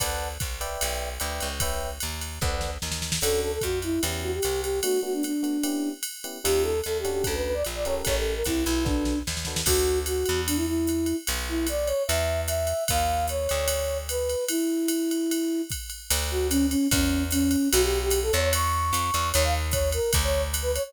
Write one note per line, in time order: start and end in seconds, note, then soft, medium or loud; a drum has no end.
0.00 0.38 D2 medium
0.00 0.28 B4 medium
0.00 0.28 D5 medium
0.00 0.28 F#5 medium
0.00 0.28 A5 medium
0.00 kick medium
0.00 ride loud
0.40 0.77 C2 medium
0.40 kick medium
0.40 hi-hat pedal medium
0.40 ride medium
0.61 1.09 B4 medium
0.61 1.09 D5 medium
0.61 1.09 E5 medium
0.61 1.09 G5 medium
0.61 ride medium
0.81 1.18 B1 medium
0.81 ride medium
1.20 1.40 D2 medium
1.20 1.48 B4 medium
1.20 1.48 D5 medium
1.20 1.48 E5 medium
1.20 1.48 G5 medium
1.20 hi-hat pedal medium
1.20 ride medium
1.40 1.99 C#2 medium
1.40 ride medium
1.60 1.89 B4 medium
1.60 1.89 C#5 medium
1.60 1.89 E5 medium
1.60 1.89 G5 medium
1.60 kick medium
1.60 ride medium
2.00 2.39 D#2 medium
2.00 hi-hat pedal medium
2.00 ride medium
2.21 ride medium
2.41 2.78 D2 medium
2.41 2.70 A4 medium
2.41 2.70 B4 medium
2.41 2.70 D5 loud
2.41 2.70 F#5 medium
2.41 kick medium
2.41 snare medium
2.61 snare medium
2.82 3.19 D#2 medium
2.82 snare medium
2.92 snare medium
3.02 snare medium
3.12 snare loud
3.21 3.59 D2 medium
3.21 3.51 C#4 medium
3.21 3.51 D4 medium
3.21 3.51 F#4 medium
3.21 3.41 A4 medium
3.21 3.51 A4 medium
3.21 crash medium
3.21 ride medium
3.42 3.52 A4 medium
3.52 3.62 A4 medium
3.61 3.99 F2 medium
3.61 3.79 F#4 medium
3.61 kick medium
3.61 hi-hat pedal medium
3.61 ride medium
3.82 4.01 E4 medium
3.82 ride medium
4.03 4.40 E2 medium
4.03 4.31 B3 medium
4.03 4.31 C#4 medium
4.03 4.31 E4 medium
4.03 4.31 G4 medium
4.03 ride medium
4.23 4.32 F#4 medium
4.34 4.61 G4 medium
4.42 4.81 C2 medium
4.42 hi-hat pedal medium
4.42 ride medium
4.62 4.79 G4 medium
4.62 ride medium
4.83 4.97 A3 medium
4.83 4.97 B3 medium
4.83 4.97 D4 medium
4.83 5.00 F#4 medium
4.83 4.97 F#4 medium
4.83 ride loud
5.03 5.31 A3 medium
5.03 5.31 B3 medium
5.03 5.31 D4 medium
5.03 5.31 F#4 medium
5.03 5.13 F#4 medium
5.14 5.23 D4 medium
5.23 5.90 D4 medium
5.23 hi-hat pedal medium
5.23 ride medium
5.43 5.57 A3 medium
5.43 5.57 B3 medium
5.43 5.57 D4 medium
5.43 5.57 F#4 medium
5.43 ride medium
5.63 5.92 B3 medium
5.63 5.92 C#4 medium
5.63 5.92 E4 medium
5.63 5.92 G4 medium
5.63 ride medium
6.03 hi-hat pedal medium
6.03 ride medium
6.24 6.38 B3 medium
6.24 6.38 C#4 medium
6.24 6.38 E4 medium
6.24 6.38 G4 medium
6.24 ride medium
6.44 6.81 D#2 medium
6.44 6.73 C#4 medium
6.44 6.73 D#4 medium
6.44 6.73 F4 medium
6.44 6.63 G4 medium
6.44 6.73 G4 medium
6.44 ride loud
6.63 6.80 A4 medium
6.84 7.22 D#2 medium
6.84 6.98 A4 medium
6.84 hi-hat pedal medium
6.84 ride medium
6.99 7.11 G4 medium
7.04 7.53 C#4 medium
7.04 7.53 D4 medium
7.04 7.53 F#4 medium
7.04 7.53 A4 medium
7.04 ride medium
7.12 7.24 G4 medium
7.24 7.63 D2 medium
7.24 7.35 A4 medium
7.24 kick medium
7.24 ride medium
7.34 7.44 B4 medium
7.45 7.55 B4 medium
7.54 7.64 D5 medium
7.65 8.02 A#1 medium
7.65 hi-hat pedal medium
7.65 ride medium
7.75 7.85 D5 medium
7.85 8.34 C#4 medium
7.85 8.34 G4 medium
7.85 8.34 A4 medium
7.85 8.34 A#4 medium
7.85 7.95 C#5 medium
7.85 ride medium
8.05 8.43 A1 medium
8.05 8.15 C#5 medium
8.05 kick medium
8.05 ride medium
8.17 8.33 A4 medium
8.35 8.44 A#4 medium
8.44 8.65 C2 medium
8.44 8.64 E4 medium
8.44 kick soft
8.44 hi-hat pedal medium
8.44 ride medium
8.64 9.23 B1 medium
8.64 8.84 E4 medium
8.64 ride medium
8.85 9.13 D4 medium
8.85 9.19 D4 medium
8.85 9.13 F#4 medium
8.85 9.13 A4 medium
8.85 9.13 B4 medium
8.85 kick medium
8.85 snare medium
9.05 snare medium
9.27 9.63 D#2 medium
9.27 snare medium
9.37 snare medium
9.45 9.61 D4 medium
9.45 9.61 F#4 medium
9.45 9.61 A4 medium
9.45 9.61 B4 medium
9.45 snare medium
9.56 snare medium
9.66 10.24 D2 loud
9.66 9.99 F#4 medium
9.66 kick medium
9.66 crash loud
9.66 ride medium
10.06 10.41 F#4 medium
10.06 hi-hat pedal medium
10.06 ride medium
10.26 11.13 E2 medium
10.26 ride medium
10.47 10.57 D4 medium
10.47 ride loud
10.56 10.66 E4 medium
10.67 11.16 E4 medium
10.87 hi-hat pedal medium
10.87 ride medium
11.06 ride medium
11.27 11.93 B1 medium
11.27 ride medium
11.49 11.67 E4 medium
11.67 11.88 D5 medium
11.67 hi-hat pedal medium
11.67 ride medium
11.86 12.03 C#5 medium
11.86 ride medium
12.07 12.73 E2 loud
12.07 12.41 E5 medium
12.07 ride medium
12.47 12.84 E5 medium
12.47 hi-hat pedal medium
12.47 ride medium
12.67 ride medium
12.88 13.48 D#2 medium
12.88 13.26 F5 medium
12.88 kick medium
12.88 ride loud
13.28 13.98 C#5 medium
13.28 hi-hat pedal medium
13.28 ride medium
13.49 14.35 D2 medium
13.49 ride medium
13.68 ride loud
14.09 14.45 B4 medium
14.09 hi-hat pedal medium
14.09 ride medium
14.29 ride medium
14.48 15.62 E4 medium
14.48 ride loud
14.88 hi-hat pedal medium
14.88 ride medium
15.11 ride medium
15.31 ride medium
15.70 kick medium
15.70 hi-hat pedal medium
15.70 ride medium
15.90 ride medium
16.10 16.75 D2 loud
16.10 ride loud
16.31 16.47 F#4 medium
16.50 16.66 C#4 medium
16.50 hi-hat pedal medium
16.50 ride medium
16.70 16.87 C#4 medium
16.70 ride medium
16.91 17.56 E2 loud
16.91 17.23 C#4 medium
16.91 kick medium
16.91 ride loud
17.31 17.69 C#4 medium
17.31 hi-hat pedal medium
17.31 ride medium
17.51 ride medium
17.72 18.31 B1 loud
17.72 17.82 F#4 loud
17.72 ride loud
17.83 17.99 G4 medium
18.02 18.20 G4 medium
18.10 hi-hat pedal medium
18.10 ride medium
18.23 18.32 A4 medium
18.32 18.92 E2 loud
18.32 18.41 C#5 medium
18.32 ride medium
18.41 18.51 C#5 medium
18.53 19.29 C#6 medium
18.53 ride loud
18.93 19.11 F2 medium
18.93 hi-hat pedal medium
18.93 ride medium
19.14 19.32 E2 medium
19.14 ride medium
19.33 19.99 D#2 loud
19.33 19.43 C#5 medium
19.33 ride loud
19.44 19.54 F5 medium
19.71 19.90 C#5 medium
19.71 kick medium
19.71 hi-hat pedal medium
19.71 ride medium
19.92 20.11 A#4 medium
19.92 ride medium
20.13 20.79 D2 loud
20.13 kick medium
20.13 ride loud
20.23 20.42 C#5 medium
20.54 hi-hat pedal medium
20.54 ride medium
20.62 20.72 B4 medium
20.74 20.83 C#5 medium
20.74 ride medium
20.84 20.93 C#5 medium